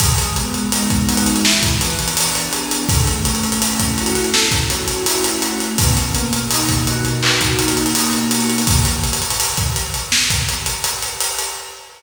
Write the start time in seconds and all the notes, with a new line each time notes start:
0.00 G#3, kick, closed hi-hat
0.18 closed hi-hat
0.36 B3, closed hi-hat
0.54 closed hi-hat
0.72 D#4, closed hi-hat
0.90 kick, closed hi-hat
1.08 F#4, closed hi-hat
1.17 closed hi-hat
1.26 closed hi-hat
1.36 closed hi-hat
1.45 E3, snare
1.63 kick, closed hi-hat
1.81 B3, closed hi-hat
1.90 closed hi-hat
1.99 closed hi-hat
2.08 closed hi-hat
2.17 D4, closed hi-hat
2.35 closed hi-hat
2.52 G#4, closed hi-hat
2.71 closed hi-hat
2.89 A3, kick, closed hi-hat
3.07 closed hi-hat
3.25 C#4, closed hi-hat
3.35 closed hi-hat
3.44 closed hi-hat
3.52 closed hi-hat
3.61 E4, closed hi-hat
3.80 kick, closed hi-hat
3.98 F#4, closed hi-hat
4.06 closed hi-hat
4.15 snare, closed hi-hat
4.24 closed hi-hat
4.33 A3, snare
4.51 kick, closed hi-hat
4.70 C#4, closed hi-hat
4.88 closed hi-hat
5.06 E4, closed hi-hat
5.24 closed hi-hat
5.40 F#4, closed hi-hat
5.60 closed hi-hat
5.78 B2, kick, closed hi-hat
5.97 closed hi-hat
6.15 A#3, closed hi-hat
6.33 closed hi-hat
6.50 D#4, closed hi-hat
6.69 kick, closed hi-hat
6.87 F#4, closed hi-hat
7.05 closed hi-hat
7.23 B2, clap
7.41 kick, closed hi-hat
7.58 A#3, closed hi-hat
7.68 closed hi-hat
7.77 closed hi-hat
7.86 closed hi-hat
7.94 D#4, closed hi-hat
8.13 closed hi-hat
8.31 F#4, closed hi-hat
8.40 closed hi-hat
8.50 closed hi-hat
8.58 closed hi-hat
8.67 kick, closed hi-hat
8.85 closed hi-hat
9.04 closed hi-hat
9.13 closed hi-hat
9.22 closed hi-hat
9.30 closed hi-hat
9.40 closed hi-hat
9.57 kick, closed hi-hat
9.76 snare, closed hi-hat
9.94 closed hi-hat
10.12 snare
10.30 kick, closed hi-hat
10.48 snare, closed hi-hat
10.66 closed hi-hat
10.84 closed hi-hat
11.03 closed hi-hat
11.20 closed hi-hat
11.39 closed hi-hat